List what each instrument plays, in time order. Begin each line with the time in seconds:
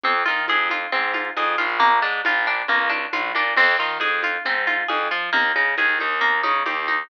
0.03 electric bass (finger) F2, acoustic guitar (steel) C4, low conga
0.26 electric bass (finger) D#3, acoustic guitar (steel) F4, high conga
0.48 electric bass (finger) F2, acoustic guitar (steel) G#4, tambourine, high conga
0.70 acoustic guitar (steel) F4, high conga
0.92 electric bass (finger) G#2, acoustic guitar (steel) C4, low conga
1.14 acoustic guitar (steel) F4, high conga
1.37 electric bass (finger) F2, acoustic guitar (steel) G#4, tambourine, high conga
1.58 electric bass (finger) A#1, acoustic guitar (steel) F4, high conga
1.80 acoustic guitar (steel) A#3, low conga
2.02 electric bass (finger) G#2, acoustic guitar (steel) D4
2.25 electric bass (finger) A#1, acoustic guitar (steel) F4, tambourine, high conga
2.47 acoustic guitar (steel) D4
2.68 electric bass (finger) C#2, acoustic guitar (steel) A#3, low conga
2.90 acoustic guitar (steel) D4, high conga
3.13 electric bass (finger) A#1, acoustic guitar (steel) F4, tambourine, high conga
3.35 electric bass (finger) A#2, acoustic guitar (steel) D4, high conga
3.56 electric bass (finger) F2, acoustic guitar (steel) C4, crash, low conga
3.79 electric bass (finger) D#3, acoustic guitar (steel) F4
4.00 electric bass (finger) F2, acoustic guitar (steel) G#4, tambourine, high conga
4.23 acoustic guitar (steel) F4, high conga
4.45 electric bass (finger) G#2, acoustic guitar (steel) C4, low conga
4.67 acoustic guitar (steel) F4, high conga
4.88 electric bass (finger) F2, acoustic guitar (steel) G#4, tambourine, high conga
5.11 electric bass (finger) F3, acoustic guitar (steel) F4
5.33 electric bass (finger) D#2, acoustic guitar (steel) A#3, low conga
5.56 electric bass (finger) C#3, acoustic guitar (steel) D#4, high conga
5.77 electric bass (finger) D#2, acoustic guitar (steel) G#4, tambourine, high conga
5.99 electric bass (finger) D#2, acoustic guitar (steel) D#4, high conga
6.21 acoustic guitar (steel) A#3, low conga
6.43 electric bass (finger) C#3, acoustic guitar (steel) D#4, high conga
6.66 electric bass (finger) D#2, acoustic guitar (steel) G4, tambourine, high conga
6.88 acoustic guitar (steel) D#4, high conga